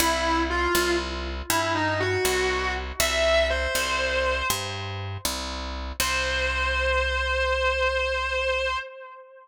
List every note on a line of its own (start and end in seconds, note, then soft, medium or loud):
0.00 0.68 C2 loud
0.00 0.40 E4 loud
0.50 0.94 F4 medium
0.75 1.42 C2 loud
1.50 2.17 G2 loud
1.50 1.71 E4 medium
1.75 1.99 D#4 medium
2.00 2.73 F#4 loud
2.25 2.92 C2 medium
3.00 3.67 C2 loud
3.00 3.47 E5 loud
3.50 4.46 C5 medium
3.75 4.42 C2 medium
4.50 5.18 G2 medium
5.25 5.92 C2 medium
6.00 8.76 C2 loud
6.00 8.76 C5 loud